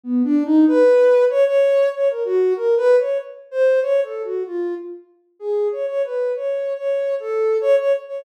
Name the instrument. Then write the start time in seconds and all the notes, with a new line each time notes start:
ocarina
0.03 B3
0.24 D4
0.45 D#4
0.68 B4
1.30 C#5
1.45 C#5
1.94 C#5
2.09 A#4
2.25 F#4
2.56 A#4
2.77 B4
2.98 C#5
3.51 C5
3.82 C#5
4.03 A4
4.24 F#4
4.46 F4
5.39 G#4
5.72 C#5
5.88 C#5
6.04 B4
6.35 C#5
6.77 C#5
7.20 A4
7.61 C#5
7.78 C#5
8.08 C#5